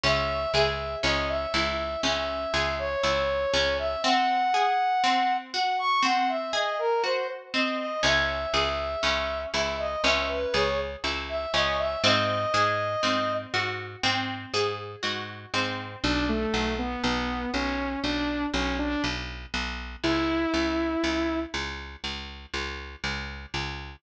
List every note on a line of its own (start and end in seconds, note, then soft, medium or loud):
0.04 0.46 C#2 medium
0.04 0.54 C#4 medium
0.04 0.52 E5 loud
0.54 0.96 C#2 medium
0.54 1.05 G#4 medium
0.54 0.96 E5 medium
1.03 1.46 C#2 medium
1.03 1.53 C#4 medium
1.03 1.27 D#5 medium
1.29 2.01 E5 medium
1.54 1.96 C#2 medium
1.54 2.04 E4 medium
2.03 2.46 C#2 medium
2.03 2.53 C#4 medium
2.03 2.75 E5 medium
2.54 2.96 C#2 medium
2.54 3.04 G#4 medium
2.79 3.74 C#5 medium
3.04 3.46 C#2 medium
3.04 3.54 E4 medium
3.54 3.96 C#2 medium
3.54 4.01 C#4 medium
3.79 4.03 E5 medium
4.04 4.54 C4 medium
4.04 5.33 F#5 loud
4.54 5.04 G#4 medium
5.04 5.54 C4 medium
5.54 6.04 F#4 medium
5.54 5.78 F#5 medium
5.79 6.03 C#6 medium
6.03 6.53 C4 medium
6.03 6.28 F#5 medium
6.29 6.52 E5 medium
6.53 7.03 G#4 medium
6.53 6.77 D#5 medium
6.79 7.02 A#4 medium
7.04 7.54 F#4 medium
7.04 7.27 C5 medium
7.54 8.01 C4 medium
7.54 7.77 D#5 medium
7.79 8.03 D#5 medium
8.03 8.46 C#2 medium
8.03 8.53 C#4 medium
8.03 9.39 E5 medium
8.54 8.96 C#2 medium
8.54 9.04 G#4 medium
9.03 9.46 C#2 medium
9.03 9.53 C#4 medium
9.54 9.96 C#2 medium
9.54 10.04 E4 medium
9.54 9.78 E5 medium
9.79 10.03 D#5 medium
10.04 10.46 C#2 medium
10.04 10.54 C#4 medium
10.04 10.28 E5 medium
10.29 10.53 B4 medium
10.54 10.96 C#2 medium
10.54 11.04 G#4 medium
10.54 10.78 C#5 medium
11.04 11.46 C#2 medium
11.04 11.54 E4 medium
11.29 11.53 E5 medium
11.54 11.96 C#2 medium
11.54 12.01 C#4 medium
11.54 11.78 D#5 medium
11.79 12.03 E5 medium
12.04 12.46 G#2 medium
12.04 12.54 C4 medium
12.04 13.33 D#5 loud
12.54 12.96 G#2 medium
12.54 13.04 G#4 medium
13.03 13.46 G#2 medium
13.03 13.53 C4 medium
13.54 13.96 G#2 medium
13.54 14.04 F#4 medium
14.04 14.46 G#2 medium
14.04 14.54 C4 medium
14.54 14.96 G#2 medium
14.54 15.04 G#4 medium
15.03 15.46 G#2 medium
15.03 15.53 F#4 medium
15.54 15.96 G#2 medium
15.54 16.01 C4 medium
16.04 16.46 B1 medium
16.04 16.27 D4 medium
16.29 16.74 A3 medium
16.54 16.96 B1 medium
16.79 17.02 B3 medium
17.04 17.46 B1 medium
17.04 17.51 B3 medium
17.54 17.96 B1 medium
17.54 18.00 C#4 medium
18.04 18.46 B1 medium
18.04 18.46 D4 medium
18.54 18.96 B1 medium
18.54 18.77 C#4 medium
18.79 19.02 D4 medium
19.04 19.46 B1 medium
19.54 19.96 B1 medium
20.04 20.46 C#2 medium
20.04 21.40 E4 loud
20.54 20.96 C#2 medium
21.04 21.46 C#2 medium
21.54 21.96 C#2 medium
22.04 22.46 C#2 medium
22.54 22.96 C#2 medium
23.04 23.46 C#2 medium
23.54 23.96 C#2 medium